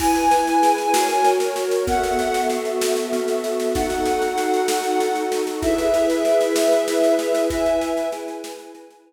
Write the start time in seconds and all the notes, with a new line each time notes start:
0.00 E4 B4 G#5, kick, snare, crash
0.15 snare
0.31 B4, snare
0.47 snare
0.62 G#4, snare
0.78 snare
0.93 F#4 A#4 C#5, snare
1.09 snare
1.24 C#5, snare
1.40 snare
1.56 A#4, snare
1.71 snare
1.87 B3 F#4 A4 E5 F#5, kick, snare
2.03 snare
2.19 E5, snare
2.34 snare
2.50 F#4, snare
2.65 snare
2.81 A4, snare
2.96 snare
3.13 B3, snare
3.28 snare
3.44 E5, snare
3.60 snare
3.75 D#4 F#4 A4 F#5, kick, snare
3.90 snare
4.05 A4, snare
4.22 snare
4.38 F#4, snare
4.54 snare
4.68 A4, snare
4.84 snare
5.00 D#4, snare
5.15 snare
5.32 A4, snare
5.47 snare
5.62 E4 G#4 B4 E5, kick, snare
5.78 snare
5.94 B4, snare
6.10 snare
6.25 G#4, snare
6.41 snare
6.56 B4, snare
6.72 snare
6.88 E4, snare
7.04 snare
7.19 B4 E5, snare
7.35 snare
7.50 E4 B4 E5 G#5, kick, snare
7.66 snare
7.81 B4, snare
7.97 snare
8.12 G#4, snare
8.28 snare
8.44 B4, snare
8.59 snare
8.75 E4, snare
8.90 snare
9.06 B4